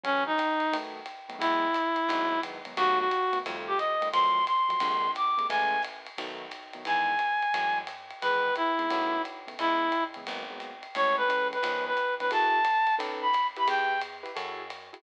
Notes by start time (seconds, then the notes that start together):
0.04 E3 F#3 A3 C#4, ride
0.26 D#4
0.38 kick, hi-hat pedal, ride
0.60 ride
0.72 D#3 F#3 A3 B3, ride
1.06 hi-hat pedal, ride
1.29 D#3 F#3 A3 B3, ride
1.39 E2 E3 F#3 G#3 B3 E4, kick, ride
1.74 hi-hat pedal, ride
1.96 ride
2.09 G#1 D#3 F#3 G#3 B3, ride
2.43 D#3 F#3 G#3 B3, kick, hi-hat pedal, ride
2.65 D#3 F#3 G#3 B3, ride
2.77 D#2 D#3 F#3 A3 B3 F#4, ride
2.99 F#4
3.11 hi-hat pedal, ride
3.33 D#3 F#3 A3 B3, ride
3.46 F2 D#3 F3 G3 A3, ride
3.67 G4
3.78 D#5, hi-hat pedal, ride
4.01 D#3 F3 G3 A3, ride
4.12 F2 D#3 F3 F#3 A3 C6, ride
4.47 C6, hi-hat pedal, ride
4.69 D#3 F3 F#3 A3, ride
4.80 A#1 C3 D3 G#3 A#3, ride
5.15 D6, hi-hat pedal, ride
5.37 C3 D3 G#3 A#3, ride
5.50 A1 C#3 E3 G#3 A3 G#5, ride
5.82 hi-hat pedal, ride
6.06 ride
6.18 B1 D#3 F#3 A3 B3, ride
6.51 kick, hi-hat pedal, ride
6.73 D#3 F#3 A3 B3, ride
6.85 E2 D#3 E3 G#3 B3 G#5, ride
7.19 hi-hat pedal, ride
7.42 ride
7.54 F#2 E3 F#3 G#3 A3, ride
7.87 hi-hat pedal, ride
8.11 ride
8.22 E2 D#3 E3 G#3 B3 B4, ride
8.56 E4, hi-hat pedal, ride
8.79 D#3 E3 G#3 B3, ride
8.90 B1 C#3 D#3 A3 B3, ride
9.25 kick, hi-hat pedal, ride
9.47 C#3 D#3 A3 B3, ride
9.59 C#2 C#3 E3 G#3 B3 E4, kick, ride
9.92 hi-hat pedal, ride
10.14 C#3 E3 G#3 B3, ride
10.27 G#1 F#3 G#3 A#3 B3, ride
10.50 F#3 G#3 A#3 B3
10.60 hi-hat pedal, ride
10.83 ride
10.95 A1 E3 G#3 A3 C#4 C#5, ride
11.17 B4
11.28 E3 G#3 A3 C#4, hi-hat pedal, ride
11.53 B4, ride
11.63 C#2 D#3 F3 B3 C#4, ride
11.87 B4
11.97 kick, hi-hat pedal, ride
12.20 D#3 F3 B3 C#4 B4, ride
12.31 F#2 E4 F#4 G#4 A4 A5, kick, ride
12.64 hi-hat pedal, ride
12.87 ride
12.99 B1 C#4 D#4 A4 B4, ride
13.22 B5
13.33 kick, hi-hat pedal, ride
13.56 E4 G4 B4 B5, ride
13.68 E2 G5, ride
14.01 hi-hat pedal, ride
14.23 E4 G4 B4, ride
14.36 F#2 E4 F#4 G#4 A4, ride
14.70 hi-hat pedal, ride
14.93 E4 F#4 G#4 A4, ride